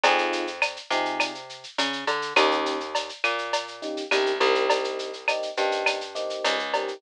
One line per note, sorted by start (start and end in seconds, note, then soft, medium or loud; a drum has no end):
0.04 0.78 F2 loud
0.04 0.45 C4 loud
0.04 0.45 D#4 loud
0.04 0.45 F4 loud
0.04 0.45 G#4 loud
0.04 cowbell loud
0.04 shaker loud
0.18 shaker medium
0.33 shaker loud
0.47 shaker medium
0.62 cowbell medium
0.62 claves loud
0.62 shaker loud
0.76 shaker medium
0.90 1.65 C3 medium
0.90 1.31 C4 medium
0.90 1.31 D#4 loud
0.90 1.31 F4 loud
0.90 1.31 G#4 loud
0.90 shaker loud
1.05 shaker medium
1.20 cowbell medium
1.20 claves loud
1.20 shaker loud
1.35 shaker medium
1.49 shaker medium
1.63 shaker medium
1.78 2.04 C#3 medium
1.78 cowbell medium
1.78 shaker loud
1.93 shaker medium
2.07 2.33 D3 medium
2.07 cowbell medium
2.07 shaker medium
2.22 shaker medium
2.36 3.10 D#2 loud
2.36 2.77 A#3 loud
2.36 2.77 C#4 loud
2.36 2.77 D#4 loud
2.36 2.77 G4 loud
2.36 cowbell medium
2.36 claves loud
2.36 shaker loud
2.51 shaker medium
2.66 shaker loud
2.80 shaker medium
2.95 cowbell loud
2.95 shaker loud
3.09 shaker medium
3.24 3.98 A#2 medium
3.24 claves loud
3.24 shaker medium
3.38 shaker medium
3.53 cowbell loud
3.53 shaker loud
3.68 shaker medium
3.82 4.02 A#3 medium
3.82 4.02 C#4 loud
3.82 4.02 D#4 medium
3.82 4.02 G4 medium
3.82 shaker medium
3.97 shaker medium
4.11 4.39 C2 medium
4.11 4.32 A#3 loud
4.11 4.32 C#4 loud
4.11 4.32 D#4 loud
4.11 4.32 G4 loud
4.11 cowbell medium
4.11 claves loud
4.11 shaker loud
4.26 shaker medium
4.40 5.44 C2 medium
4.40 5.11 A#3 loud
4.40 5.11 C4 loud
4.40 5.11 D#4 loud
4.40 5.11 G4 loud
4.40 cowbell medium
4.40 shaker medium
4.55 shaker medium
4.70 cowbell loud
4.70 shaker loud
4.84 shaker medium
4.99 shaker medium
5.13 shaker medium
5.28 5.49 A#3 medium
5.28 5.49 C4 medium
5.28 5.49 D#4 loud
5.28 5.49 G4 medium
5.28 cowbell medium
5.28 claves loud
5.28 shaker loud
5.42 shaker medium
5.57 6.32 G2 medium
5.57 5.98 A#3 loud
5.57 5.98 C4 loud
5.57 5.98 D#4 loud
5.57 5.98 G4 loud
5.57 shaker medium
5.72 shaker medium
5.86 cowbell medium
5.86 claves loud
5.86 shaker loud
6.01 shaker medium
6.15 6.56 A#3 loud
6.15 6.56 C4 loud
6.15 6.56 D#4 loud
6.15 6.56 G4 loud
6.15 shaker medium
6.30 shaker medium
6.44 6.94 C#2 medium
6.44 cowbell medium
6.44 shaker loud
6.59 shaker medium
6.74 6.94 A#3 loud
6.74 6.94 C4 medium
6.74 6.94 D#4 loud
6.74 6.94 G4 loud
6.74 cowbell loud
6.74 shaker medium
6.88 shaker medium